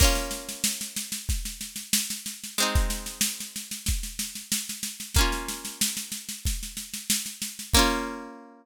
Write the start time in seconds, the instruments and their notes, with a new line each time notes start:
0.00 acoustic guitar (steel) A#3 C#4, kick, snare, crash
0.04 acoustic guitar (steel) F4
0.15 snare
0.31 snare
0.49 snare
0.64 snare
0.81 snare
0.96 snare
1.12 snare
1.29 kick, snare
1.45 snare
1.61 snare
1.76 snare
1.93 snare
2.10 snare
2.26 snare
2.44 snare
2.58 acoustic guitar (steel) G#3 C4, snare
2.62 acoustic guitar (steel) D#4
2.75 kick, snare
2.90 snare
3.06 snare
3.21 snare
3.40 snare
3.56 snare
3.71 snare
3.86 kick, snare
4.03 snare
4.19 snare
4.35 snare
4.52 snare
4.69 snare
4.83 snare
5.00 snare
5.15 acoustic guitar (steel) A#3, kick, snare
5.19 acoustic guitar (steel) C#4 F4
5.32 snare
5.49 snare
5.65 snare
5.81 snare
5.97 snare
6.12 snare
6.29 snare
6.45 kick, snare
6.63 snare
6.77 snare
6.94 snare
7.10 snare
7.26 snare
7.42 snare
7.59 snare
7.74 acoustic guitar (steel) A#3 C#4, kick, crash
7.79 acoustic guitar (steel) F4